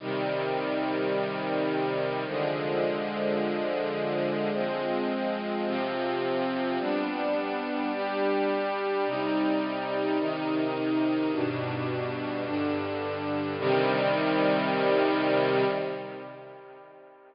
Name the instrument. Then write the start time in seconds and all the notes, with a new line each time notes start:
string ensemble 1
0.00 C3 D#3 G3
2.26 D3 F3 G#3
4.53 F3 G#3 C4
5.66 C3 F3 C4
6.79 G3 B3 D4
7.92 G3 D4 G4
9.06 C3 G3 D#4
10.19 C3 D#3 D#4
11.32 G2 B2 D4
12.45 G2 D3 D4
13.58 C3 D#3 G3